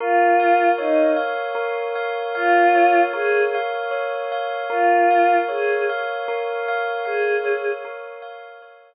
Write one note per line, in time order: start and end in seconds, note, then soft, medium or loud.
0.00 0.69 F4 medium
0.00 1.54 A#4 loud
0.40 1.16 F5 medium
0.78 1.10 D#4 medium
0.78 2.75 C#5 medium
1.16 1.95 F5 medium
1.55 3.13 A#4 loud
1.95 2.35 F5 medium
2.35 3.00 F4 medium
2.35 3.54 F5 loud
2.75 3.91 C#5 medium
3.14 3.47 G#4 medium
3.14 4.63 A#4 loud
3.55 4.31 F5 medium
3.91 4.66 C#5 medium
4.32 4.69 F5 medium
4.70 5.35 F4 medium
4.70 6.28 A#4 loud
5.11 5.89 F5 medium
5.49 5.83 G#4 medium
5.49 7.44 C#5 medium
5.89 6.68 F5 medium
6.28 7.84 A#4 loud
6.68 7.05 F5 medium
7.05 7.71 G#4 medium
7.05 8.22 F5 medium
7.44 8.62 C#5 medium
7.85 8.94 A#4 loud
8.22 8.94 F5 loud
8.62 8.94 C#5 medium